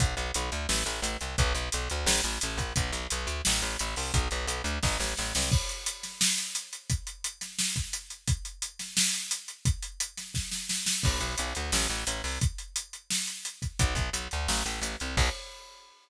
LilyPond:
<<
  \new Staff \with { instrumentName = "Electric Bass (finger)" } { \clef bass \time 4/4 \key b \minor \tempo 4 = 174 b,,8 b,,8 b,,8 d,8 a,,8 a,,8 a,,8 c,8 | b,,8 b,,8 b,,8 d,8 a,,8 a,,8 a,,8 ais,,8 | b,,8 b,,8 b,,8 d,8 a,,8 a,,8 a,,8 c,8 | b,,8 b,,8 b,,8 d,8 a,,8 a,,8 a,,8 c,8 |
\key cis \minor r1 | r1 | r1 | r1 |
\key b \minor b,,8 b,,8 b,,8 d,8 a,,8 a,,8 a,,8 c,8 | r1 | b,,8 b,,8 b,,8 d,8 a,,8 a,,8 a,,8 c,8 | b,,4 r2. | }
  \new DrumStaff \with { instrumentName = "Drums" } \drummode { \time 4/4 <hh bd>8 hh8 hh8 hh8 sn8 hh8 hh8 hh8 | <hh bd>8 hh8 hh8 hh8 sn8 hh8 hh8 <hh bd>8 | <hh bd>8 hh8 hh8 hh8 sn4 hh8 hho8 | <hh bd>8 hh8 hh8 hh8 <bd sn>8 sn8 sn8 sn8 |
<cymc bd>8 hh8 hh8 <hh sn>8 sn8 hh8 hh8 hh8 | <hh bd>8 hh8 hh8 <hh sn>8 sn8 <hh bd>8 hh8 hh8 | <hh bd>8 hh8 hh8 <hh sn>8 sn8 hh8 hh8 hh8 | <hh bd>8 hh8 hh8 <hh sn>8 <bd sn>8 sn8 sn8 sn8 |
<cymc bd>8 hh8 hh8 hh8 sn8 hh8 hh8 hho8 | <hh bd>8 hh8 hh8 hh8 sn8 hh8 hh8 <hh bd>8 | <hh bd>8 <hh bd>8 hh8 hh8 sn8 hh8 hh8 hh8 | <cymc bd>4 r4 r4 r4 | }
>>